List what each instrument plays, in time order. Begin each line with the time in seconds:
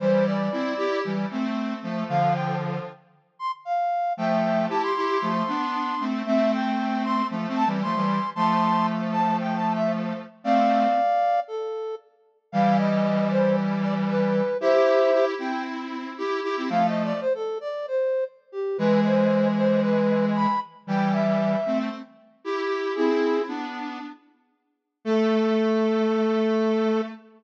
0.00 lead 1 (square) E3 G3, flute C5
0.26 flute D5
0.52 lead 1 (square) C4 E4
0.77 lead 1 (square) E4 G4
1.05 lead 1 (square) E3 G3
1.31 lead 1 (square) A3 C4
1.83 lead 1 (square) F3 A3
2.09 lead 1 (square) D3 F3, flute F5
2.34 flute G5
3.39 flute C6
3.65 flute F5
4.17 lead 1 (square) F3 A3, flute E5 G5
4.69 lead 1 (square) E4 G4, flute A5
4.83 flute C6
4.96 lead 1 (square) E4 G4
5.22 lead 1 (square) F3 A3
5.48 lead 1 (square) B3 D4
6.00 lead 1 (square) A3 C4
6.26 lead 1 (square) A3 C4, flute E5
6.52 flute G5
7.04 flute C6
7.30 lead 1 (square) F3 A3
7.48 lead 1 (square) A3 C4
7.56 flute A5
7.66 lead 1 (square) E3 G3
7.82 lead 1 (square) F3 A3, flute C6
7.95 lead 1 (square) E3 G3
8.35 lead 1 (square) F3 A3, flute A5 C6
9.12 flute A5
9.40 flute G5
9.56 flute A5
9.75 flute E5
10.44 lead 1 (square) A3 C4, flute D5 F5
11.48 flute A4
12.52 lead 1 (square) E3 G3, flute F5
12.78 flute D#5
13.30 flute C5
13.82 flute D5
14.08 flute B4
14.60 lead 1 (square) E4 G4, flute C5 E5
15.13 lead 1 (square) E4 G4
15.38 lead 1 (square) C4 E4, flute G5
16.18 lead 1 (square) E4 G4
16.43 lead 1 (square) E4 G4
16.57 lead 1 (square) C4 E4
16.69 lead 1 (square) F3 A3, flute F5
16.87 flute D#5
17.04 flute D5
17.21 flute C5
17.35 flute A4
17.61 flute D5
17.88 flute C5
18.52 flute G4
18.78 lead 1 (square) E3 G#3, flute B4
19.05 flute C5
19.57 flute C5
19.82 flute B4
20.36 flute B5
20.87 lead 1 (square) E3 G3, flute G5
21.13 flute E5
21.66 lead 1 (square) A3 C4
22.44 lead 1 (square) E4 G4
22.95 lead 1 (square) C4 E4, flute E4 G#4
23.48 lead 1 (square) B3 D4
25.04 lead 1 (square) A3, flute A4